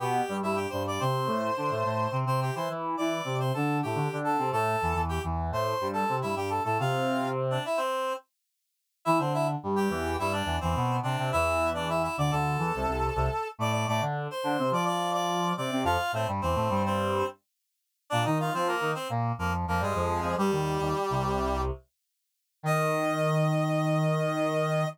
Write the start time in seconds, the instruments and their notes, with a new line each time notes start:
0.00 brass section B2 B3, clarinet G4 G5
0.29 brass section G2 G3
0.42 brass section G2 G3, clarinet E4 E5
0.55 clarinet G4 G5
0.69 brass section G2 G3, clarinet C5 C6
0.87 clarinet D5 D6
1.00 brass section C3 C4, clarinet C5 C6
1.26 brass section A2 A3
1.57 brass section D3 D4
1.70 brass section A2 A3
1.84 brass section A2 A3
2.12 brass section C3 C4
2.25 brass section C3 C4, clarinet C5 C6
2.41 clarinet G4 G5
2.55 brass section E3 E4, clarinet C5 C6
2.69 brass section E3 E4
2.97 brass section E3 E4, clarinet D5 D6
3.24 brass section C3 C4
3.39 clarinet C5 C6
3.54 brass section D3 D4, clarinet A4 A5
3.82 brass section A2 A3, clarinet G4 G5
3.95 brass section D3 D4
4.12 brass section D3 D4
4.24 clarinet A4 A5
4.38 brass section C3 C4
4.52 brass section A2 A3, clarinet A4 A5
4.82 brass section E2 E3
4.94 brass section E2 E3
5.09 clarinet G4 G5
5.24 brass section E2 E3
5.51 brass section A2 A3, clarinet C5 C6
5.81 brass section G2 G3
5.93 clarinet A4 A5
6.08 brass section C3 C4
6.22 brass section G2 G3, clarinet E4 E5
6.35 brass section G2 G3, clarinet G4 G5
6.50 clarinet A4 A5
6.64 brass section A2 A3, clarinet A4 A5
6.79 brass section C3 C4, clarinet F4 F5
7.50 clarinet D4 D5
7.65 clarinet E4 E5
7.77 clarinet C4 C5
9.05 brass section E3 E4, clarinet E4 E5
9.19 brass section D3 D4, clarinet C4 C5
9.34 clarinet E4 E5
9.63 brass section G2 G3
9.76 clarinet G4 G5
9.89 brass section E2 E3
10.19 brass section G2 G3, clarinet E4 E5
10.32 clarinet D4 D5
10.45 brass section E2 E3
10.60 brass section E2 E3, clarinet C4 C5
10.75 brass section B2 B3
11.03 brass section C3 C4, clarinet D4 D5
11.18 brass section C3 C4
11.32 brass section E2 E3, clarinet E4 E5
11.74 clarinet D4 D5
11.89 clarinet E4 E5
12.03 clarinet E4 E5
12.17 brass section D2 D3, clarinet D5 D6
12.31 brass section D2 D3, clarinet A4 A5
12.58 brass section E2 E3
12.75 brass section C2 C3
12.87 brass section C2 C3
13.15 brass section C2 C3
13.58 brass section A2 A3, clarinet D5 D6
13.72 clarinet D5 D6
13.88 brass section A2 A3, clarinet D5 D6
14.01 brass section D3 D4
14.31 clarinet C5 C6
14.44 brass section D3 D4
14.58 brass section C3 C4
14.71 brass section F3 F4, clarinet D5 D6
14.85 clarinet D5 D6
15.13 clarinet D5 D6
15.57 brass section C3 C4, clarinet D5 D6
15.71 brass section C3 C4
15.84 brass section F2 F3, clarinet F4 F5
16.12 brass section A2 A3, clarinet C4 C5
16.27 brass section G2 G3
16.41 brass section E2 E3, clarinet C4 C5
16.55 brass section A2 A3
16.70 brass section G2 G3
16.85 clarinet C4 C5
18.10 brass section A#2 A#3, clarinet D4 D5
18.25 brass section D#3 D#4, clarinet D#4 D#5
18.40 clarinet F4 F5
18.53 brass section F3 F4, clarinet C4 C5
18.67 clarinet A#3 A#4
18.81 brass section D#3 D#4
18.95 clarinet C4 C5
19.10 brass section A#2 A#3
19.38 brass section F2 F3, clarinet A#3 A#4
19.67 brass section F2 F3, clarinet A#3 A#4
19.80 brass section G2 G3, clarinet G#3 G#4
19.95 brass section F2 F3
20.21 brass section F2 F3
20.37 brass section G2 G3, clarinet G3 G4
20.51 brass section D#2 D#3
20.80 brass section D#2 D#3
21.10 brass section C2 C3
22.63 brass section D#3, clarinet D#5